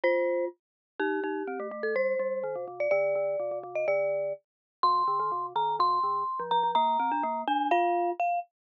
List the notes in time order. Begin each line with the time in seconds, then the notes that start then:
0.04 F4 C5
0.99 D#4 G4
1.24 D#4
1.47 C4
1.60 A3
1.71 A3
1.83 A4
1.95 G3 C5
2.19 G3
2.44 D#3
2.56 C3
2.68 C3
2.80 D5
2.91 D3 D5
3.15 D3
3.40 C3
3.51 C3
3.63 C3
3.75 D#5
3.88 D3 D5
4.83 C3 C6
5.08 D3
5.20 D#3
5.32 C3
5.55 D#3 A#5
5.79 C3 C6
6.03 D3
6.40 F3
6.51 F3 A#5
6.63 F3
6.75 A#3 A#5
7.00 C4
7.12 D4
7.23 A#3
7.48 D4 G#5
7.71 F4 F5
8.20 F5